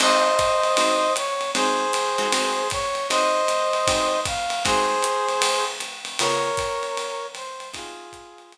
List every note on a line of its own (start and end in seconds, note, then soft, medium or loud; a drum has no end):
0.00 0.30 G#3 medium
0.00 0.30 C4 medium
0.00 0.30 D#4 medium
0.00 0.30 F#4 medium
0.00 1.13 C5 loud
0.00 1.13 D#5 loud
0.00 crash loud
0.00 ride medium
0.39 kick soft
0.39 hi-hat pedal medium
0.39 ride medium
0.64 ride medium
0.77 1.08 G#3 medium
0.77 1.08 C4 medium
0.77 1.08 D#4 medium
0.77 1.08 F#4 medium
0.77 ride loud
1.16 1.51 C#5 medium
1.16 hi-hat pedal medium
1.16 ride medium
1.41 ride medium
1.55 1.85 G#3 medium
1.55 1.85 C4 medium
1.55 1.85 D#4 medium
1.55 1.85 F#4 medium
1.55 2.68 G#4 medium
1.55 2.68 C5 loud
1.55 ride medium
1.93 hi-hat pedal medium
1.93 ride medium
2.18 2.28 G#3 medium
2.18 2.28 C4 medium
2.18 2.28 D#4 medium
2.18 2.28 F#4 medium
2.18 ride medium
2.32 2.63 G#3 medium
2.32 2.63 C4 medium
2.32 2.63 D#4 medium
2.32 2.63 F#4 medium
2.32 ride loud
2.70 3.07 C#5 loud
2.70 kick medium
2.70 hi-hat pedal medium
2.70 ride medium
2.95 ride medium
3.09 3.41 G#3 medium
3.09 3.41 C4 medium
3.09 3.41 D#4 medium
3.09 3.41 F#4 medium
3.09 4.20 C5 loud
3.09 4.20 D#5 loud
3.09 ride medium
3.48 hi-hat pedal medium
3.48 ride medium
3.73 ride medium
3.87 4.18 G#3 medium
3.87 4.18 C4 medium
3.87 4.18 D#4 medium
3.87 4.18 F#4 medium
3.87 kick medium
3.87 ride loud
4.25 4.63 F5 medium
4.25 kick medium
4.25 hi-hat pedal medium
4.25 ride medium
4.50 ride medium
4.65 4.95 G#3 medium
4.65 4.95 C4 medium
4.65 4.95 D#4 medium
4.65 4.95 F#4 medium
4.65 5.65 G#4 loud
4.65 5.65 C5 loud
4.65 kick medium
4.65 ride medium
5.03 hi-hat pedal medium
5.03 ride medium
5.29 ride medium
5.42 ride loud
5.80 hi-hat pedal medium
5.80 ride medium
6.05 ride medium
6.19 6.50 C#3 medium
6.19 6.50 B3 medium
6.19 6.50 F4 medium
6.19 6.50 G#4 medium
6.19 7.27 A#4 loud
6.19 7.27 C#5 loud
6.19 ride loud
6.57 kick medium
6.57 hi-hat pedal medium
6.57 ride medium
6.83 ride medium
6.97 ride medium
7.35 7.69 C5 medium
7.35 ride medium
7.60 ride medium
7.73 8.04 G#3 medium
7.73 8.04 C4 medium
7.73 8.04 D#4 medium
7.73 8.53 F4 medium
7.73 8.04 F#4 medium
7.73 8.53 G#4 medium
7.73 kick soft
7.73 ride loud
8.13 kick medium
8.13 hi-hat pedal medium
8.13 ride medium
8.38 ride medium
8.52 ride medium